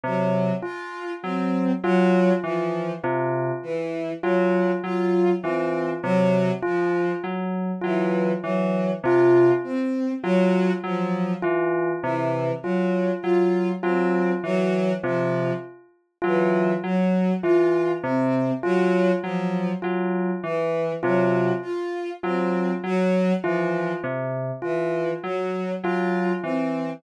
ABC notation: X:1
M:5/8
L:1/8
Q:1/4=50
K:none
V:1 name="Electric Piano 2" clef=bass
C, z _G, G, E, | C, z _G, G, E, | C, z _G, G, E, | C, z _G, G, E, |
C, z _G, G, E, | C, z _G, G, E, | C, z _G, G, E, | C, z _G, G, E, |
C, z _G, G, E, |]
V:2 name="Violin"
_G, F C G, F, | z E, _G, F C | _G, F, z E, G, | F C _G, F, z |
E, _G, F C G, | F, z E, _G, F | C _G, F, z E, | _G, F C G, F, |
z E, _G, F C |]
V:3 name="Tubular Bells"
z F z F z | F z F z F | z F z F z | F z F z F |
z F z F z | F z F z F | z F z F z | F z F z F |
z F z F z |]